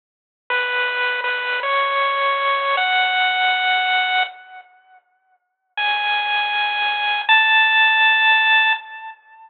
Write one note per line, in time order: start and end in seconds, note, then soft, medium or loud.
0.50 1.21 B4 medium
1.24 1.60 B4 medium
1.63 2.76 C#5 medium
2.77 4.23 F#5 medium
5.77 7.21 G#5 medium
7.29 8.73 A5 loud